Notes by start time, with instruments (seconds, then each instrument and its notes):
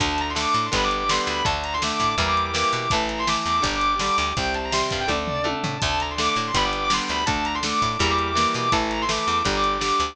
0.00 electric bass (finger) D2, overdriven guitar D3 A3, drawbar organ D4 A4, distortion guitar A5, kick, closed hi-hat
0.18 distortion guitar A#5, closed hi-hat
0.29 distortion guitar C6
0.35 overdriven guitar D3 A3, distortion guitar D6, snare
0.47 distortion guitar D6
0.54 electric bass (finger) A2, distortion guitar D6, closed hi-hat
0.66 distortion guitar C6
0.72 electric bass (finger) G1, overdriven guitar D3 G3 B3, drawbar organ D4 G4 B4, distortion guitar B5, kick, closed hi-hat
0.84 distortion guitar D6
0.91 closed hi-hat
0.98 distortion guitar D6
1.09 overdriven guitar D3 G3 B3, distortion guitar C6, snare
1.27 electric bass (finger) D2, distortion guitar B5, closed hi-hat
1.45 electric bass (finger) D2, overdriven guitar D3 A3, drawbar organ D4 A4, distortion guitar A5, kick, closed hi-hat
1.64 distortion guitar A#5, closed hi-hat
1.73 distortion guitar C6
1.82 overdriven guitar D3 A3, distortion guitar D6, snare
1.92 distortion guitar D6
2.00 electric bass (finger) A2, distortion guitar D6, kick, closed hi-hat
2.10 distortion guitar D6
2.18 electric bass (finger) E2, overdriven guitar E3 G3 A#3, drawbar organ E4 G4 A#4, distortion guitar A#5, kick, closed hi-hat
2.28 distortion guitar D6
2.37 closed hi-hat
2.45 distortion guitar D6
2.54 overdriven guitar E3 G3 A#3, distortion guitar D6, snare
2.72 electric bass (finger) B2, distortion guitar D6, closed hi-hat
2.90 electric bass (finger) A1, overdriven guitar E3 A3, drawbar organ E4 A4, distortion guitar A5, kick, closed hi-hat
3.09 distortion guitar A#5, closed hi-hat
3.19 distortion guitar C6
3.27 overdriven guitar E3 A3, distortion guitar D6, snare
3.37 distortion guitar D6
3.46 electric bass (finger) E2, distortion guitar D6, closed hi-hat
3.57 distortion guitar D6
3.62 electric bass (finger) G1, overdriven guitar D3 G3, drawbar organ D4 G4, distortion guitar A#5, kick, closed hi-hat
3.75 distortion guitar D6
3.81 closed hi-hat
3.91 distortion guitar D6
3.99 overdriven guitar D3 G3, distortion guitar D6, snare
4.17 electric bass (finger) D2, distortion guitar D6, closed hi-hat
4.37 electric bass (finger) C2, overdriven guitar C3 G3, drawbar organ C4 G4, distortion guitar G5, kick, closed hi-hat
4.54 distortion guitar A5, closed hi-hat
4.64 distortion guitar A#5
4.72 overdriven guitar C3 G3, distortion guitar C6, snare
4.82 distortion guitar C6
4.90 electric bass (finger) G2, distortion guitar F5, kick, closed hi-hat
5.00 distortion guitar G5
5.08 electric bass (finger) D2, overdriven guitar D3 A3, drawbar organ D4 A4, distortion guitar D5, kick, high tom
5.28 floor tom
5.44 overdriven guitar D3 A3, high tom
5.64 electric bass (finger) A2, floor tom
5.80 electric bass (finger) D2, overdriven guitar D3 A3, drawbar organ D4 A4, distortion guitar A5, kick, closed hi-hat
6.00 distortion guitar A#5, closed hi-hat
6.10 distortion guitar C6
6.18 overdriven guitar D3 A3, distortion guitar D6, snare
6.28 distortion guitar D6
6.36 electric bass (finger) A2, distortion guitar D6, closed hi-hat
6.46 distortion guitar C6
6.54 electric bass (finger) G1, overdriven guitar D3 G3 B3, drawbar organ D4 G4 B4, distortion guitar B5, kick, closed hi-hat
6.65 distortion guitar D6
6.73 closed hi-hat
6.84 distortion guitar D6
6.90 overdriven guitar D3 G3 B3, distortion guitar C6, snare
7.08 electric bass (finger) D2, distortion guitar B5, closed hi-hat
7.26 electric bass (finger) D2, overdriven guitar D3 A3, drawbar organ D4 A4, distortion guitar A5, kick, closed hi-hat
7.45 distortion guitar A#5, closed hi-hat
7.55 distortion guitar C6
7.63 overdriven guitar D3 A3, distortion guitar D6, snare
7.72 distortion guitar D6
7.82 electric bass (finger) A2, distortion guitar D6, kick, closed hi-hat
7.92 distortion guitar D6
7.99 electric bass (finger) E2, overdriven guitar E3 G3 A#3, drawbar organ E4 G4 A#4, distortion guitar A#5, kick, closed hi-hat
8.10 distortion guitar D6
8.18 closed hi-hat
8.27 distortion guitar D6
8.35 overdriven guitar E3 G3 A#3, distortion guitar D6, snare
8.54 electric bass (finger) B2, distortion guitar D6, closed hi-hat
8.72 electric bass (finger) A1, overdriven guitar E3 A3, drawbar organ E4 A4, distortion guitar A5, kick, closed hi-hat
8.91 distortion guitar A#5, closed hi-hat
9.02 distortion guitar C6
9.08 overdriven guitar E3 A3, distortion guitar D6, snare
9.20 distortion guitar D6
9.27 electric bass (finger) E2, distortion guitar D6, closed hi-hat
9.38 distortion guitar D6
9.45 electric bass (finger) G1, overdriven guitar D3 G3, drawbar organ D4 G4, distortion guitar A#5, kick, closed hi-hat
9.56 distortion guitar D6
9.64 closed hi-hat
9.73 distortion guitar D6
9.81 overdriven guitar D3 G3, distortion guitar D6, snare
10.00 electric bass (finger) D2, distortion guitar D6, closed hi-hat